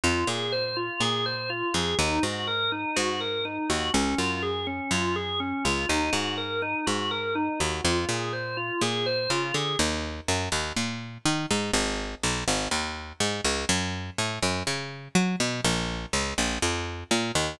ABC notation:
X:1
M:4/4
L:1/8
Q:1/4=123
K:Ebdor
V:1 name="Drawbar Organ"
F A c F A c F A | E G B E G B E G | D F A D F A D F | E G B E G B E G |
F A c F A c F A | z8 | z8 | z8 |
z8 |]
V:2 name="Electric Bass (finger)" clef=bass
F,, B,,3 B,,3 F,, | E,, A,,3 A,,3 E,, | D,, G,,3 G,,3 D,, | E,, A,,3 A,,3 E,, |
F,, B,,3 B,,2 D, =D, | E,,2 G,, E,, B,,2 E, A,, | A,,,2 =B,,, A,,, E,,2 A,, D,, | G,,2 =A,, G,, D,2 G, =B,, |
B,,,2 D,, B,,, F,,2 B,, E,, |]